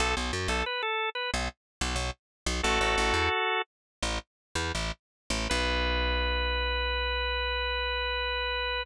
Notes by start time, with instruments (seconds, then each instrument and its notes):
0.00 electric bass (finger) B1, drawbar organ A4
0.17 electric bass (finger) B1
0.33 electric bass (finger) F#2
0.48 electric bass (finger) B1, drawbar organ A4
0.66 drawbar organ B4
0.83 drawbar organ A4
1.15 drawbar organ B4
1.34 electric bass (finger) B1
1.81 electric bass (finger) B1
1.96 electric bass (finger) B1
2.46 electric bass (finger) B1
2.63 electric bass (finger) A1, drawbar organ F#4 A4
2.81 electric bass (finger) A1
2.98 electric bass (finger) A1
3.14 electric bass (finger) E2
4.03 electric bass (finger) A1
4.55 electric bass (finger) E2
4.75 electric bass (finger) A1
5.30 electric bass (finger) A1
5.50 electric bass (finger) B1, drawbar organ B4